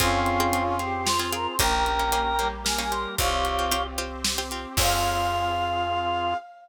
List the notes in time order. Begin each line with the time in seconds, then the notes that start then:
0.00 F2 C4 C#4 F4 G#4, kick, closed hi-hat
0.26 closed hi-hat
0.40 C4 F4 G#4
0.53 C4 F4 G#4, closed hi-hat
0.79 C4 F4 G4 G#4 C5, closed hi-hat
1.06 F4 C5, snare
1.19 C4 F4 G#4
1.33 C4 F4 G#4 A#4, closed hi-hat
1.47 C5
1.59 A#1 A#3 C#4 G4 A#4 G5 A#5, kick, closed hi-hat
1.86 closed hi-hat
1.99 A#3 C#4 G4
2.12 A#3 C#4 G4, closed hi-hat
2.39 G3 A#3 C#4 G4, closed hi-hat
2.65 A#4 G#5, snare
2.78 A#3 C#4 G4 G#5
2.91 A#3 C#4 G4 C6, closed hi-hat
3.18 C2 C4 F4 G4 C#5 F5, kick, closed hi-hat
3.45 closed hi-hat
3.59 C4 F4 G4
3.71 C4 F4 G4, closed hi-hat
3.98 C4 F4 G4 C5, closed hi-hat
4.24 snare
4.38 C4 F4 G4
4.51 C4 F4 G4, closed hi-hat
4.77 F2 C4 F4 G#4 F5, kick, crash